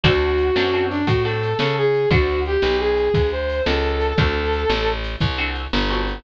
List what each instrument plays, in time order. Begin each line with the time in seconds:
0.03 electric bass (finger) D2, acoustic guitar (steel) C4 D4 F#4 A4, brass section F#4, kick, ride
0.38 ride
0.56 electric bass (finger) F#2, acoustic guitar (steel) C4 D4 F#4 A4, snare
0.73 acoustic guitar (steel) C4 D4 F#4 A4
0.90 brass section D4, ride
1.07 electric bass (finger) A2, brass section F#4, kick, ride
1.24 acoustic guitar (steel) C4 D4 F#4 A4, brass section A4
1.43 ride
1.59 electric bass (finger) C#3, brass section A4, snare
1.78 brass section G#4
1.94 ride
2.10 electric bass (finger) D2, acoustic guitar (steel) C4 D4 F#4 A4, brass section F#4, kick, ride
2.45 brass section G4, ride
2.62 electric bass (finger) B1, snare
2.79 brass section G#4
2.97 ride
3.14 electric bass (finger) D2, kick, ride
3.32 brass section C5
3.49 ride
3.65 electric bass (finger) C#2, brass section A4, snare
4.01 ride
4.18 electric bass (finger) D2, acoustic guitar (steel) C4 D4 F#4 A4, brass section A4, kick, ride
4.53 ride
4.70 electric bass (finger) A1, snare
5.04 ride
5.20 electric bass (finger) C2, kick, ride
5.38 acoustic guitar (steel) C4 D4 F#4 A4
5.55 ride
5.73 electric bass (finger) G1, snare
5.90 acoustic guitar (steel) C4 D4 F#4 A4
6.08 ride